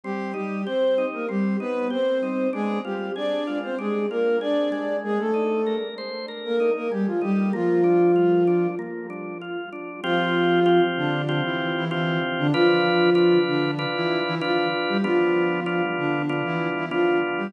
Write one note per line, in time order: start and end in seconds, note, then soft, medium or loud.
0.04 0.34 G3 medium
0.04 0.32 C4 medium
0.04 0.34 G4 medium
0.34 0.64 G3 medium
0.34 0.62 D#4 medium
0.34 0.64 G4 medium
0.65 1.06 C4 medium
0.65 0.95 G4 medium
0.65 1.06 C5 medium
0.98 1.26 D#4 medium
1.13 1.28 A#3 medium
1.13 1.28 A#4 medium
1.29 1.56 G3 medium
1.29 1.57 C4 medium
1.29 1.56 G4 medium
1.60 1.87 B3 medium
1.60 1.88 D#4 medium
1.60 1.87 B4 medium
1.90 2.48 C4 medium
1.90 2.18 G4 medium
1.90 2.48 C5 medium
2.23 2.51 D#4 medium
2.53 2.79 G#3 medium
2.53 2.81 D4 medium
2.53 2.79 G#4 loud
2.85 3.10 G3 medium
2.85 3.13 F4 medium
2.85 3.10 G4 medium
3.16 3.58 D4 medium
3.16 3.44 G#4 medium
3.16 3.58 D5 medium
3.47 3.75 F4 medium
3.63 3.78 C4 medium
3.63 3.78 C5 medium
3.79 4.06 G#3 medium
3.79 4.07 D4 medium
3.79 4.06 G#4 medium
4.10 4.37 A#3 medium
4.10 4.39 F4 medium
4.10 4.37 A#4 medium
4.41 4.97 D4 medium
4.41 4.69 G#4 medium
4.41 4.97 D5 medium
4.72 5.31 G#3 medium
5.04 5.19 G#3 medium
5.04 5.19 G#4 medium
5.19 5.75 A3 medium
5.19 5.75 A4 medium
5.34 5.62 D#4 medium
5.66 5.95 A#4 medium
5.98 6.26 C5 medium
6.28 6.56 A#4 medium
6.45 6.70 A#3 medium
6.45 6.70 A#4 medium
6.60 6.88 D#4 medium
6.75 6.90 A#3 medium
6.75 6.90 A#4 medium
6.91 7.06 G3 medium
6.91 7.20 G#3 medium
6.91 7.06 G4 medium
7.06 7.21 F3 medium
7.06 7.21 F4 medium
7.21 7.52 G3 medium
7.21 7.50 D#4 medium
7.21 7.52 G4 medium
7.53 8.67 F3 medium
7.53 7.81 A#3 loud
7.53 8.67 F4 medium
7.84 8.12 D4 medium
8.16 8.44 F4 medium
8.47 8.75 D4 medium
8.79 9.07 A#3 medium
9.10 9.38 D4 medium
9.41 9.70 F4 medium
9.73 10.01 D4 medium
10.04 10.80 F3 loud
10.04 10.60 C4 loud
10.04 10.60 F4 loud
10.04 10.80 F4 loud
10.04 10.60 G4 loud
10.66 11.22 C4 medium
10.66 11.22 F4 loud
10.66 11.22 G4 medium
10.97 11.40 D3 medium
10.97 11.40 D4 loud
11.29 11.85 C4 loud
11.29 11.85 F4 medium
11.29 11.85 G4 loud
11.44 11.73 E3 medium
11.44 11.73 E4 medium
11.76 11.90 E3 medium
11.76 11.90 E4 medium
11.91 12.19 E3 medium
11.91 12.47 C4 loud
11.91 12.19 E4 medium
11.91 12.47 F4 loud
11.91 12.47 G4 medium
12.38 12.53 D3 medium
12.38 12.53 D4 loud
12.53 13.38 F3 medium
12.53 13.10 D4 loud
12.53 13.38 F4 loud
12.53 13.10 F4 loud
12.53 13.10 B4 loud
13.15 13.71 D4 medium
13.15 13.71 F4 loud
13.15 13.71 B4 loud
13.47 13.85 D3 medium
13.47 13.85 D4 medium
13.79 14.35 D4 loud
13.79 14.35 F4 loud
13.79 14.35 B4 loud
13.95 14.20 E3 medium
13.95 14.20 E4 medium
14.25 14.40 E3 medium
14.25 14.40 E4 loud
14.41 14.67 F3 medium
14.41 14.98 D4 loud
14.41 14.67 F4 medium
14.41 14.98 F4 loud
14.41 14.98 B4 loud
14.88 15.03 G3 medium
14.88 15.03 G4 medium
15.03 15.82 F3 medium
15.03 15.60 B3 loud
15.03 15.60 D4 loud
15.03 15.82 F4 medium
15.03 15.60 F4 loud
15.66 16.22 B3 loud
15.66 16.22 D4 medium
15.66 16.22 F4 loud
15.97 16.41 D3 medium
15.97 16.41 D4 medium
16.29 16.86 B3 medium
16.29 16.86 D4 loud
16.29 16.86 F4 medium
16.44 16.69 E3 medium
16.44 16.69 E4 medium
16.75 16.90 E3 medium
16.75 16.90 E4 medium
16.91 17.18 F3 medium
16.91 17.48 B3 medium
16.91 17.48 D4 loud
16.91 17.18 F4 medium
16.91 17.48 F4 loud
17.38 17.52 G3 medium
17.38 17.52 G4 medium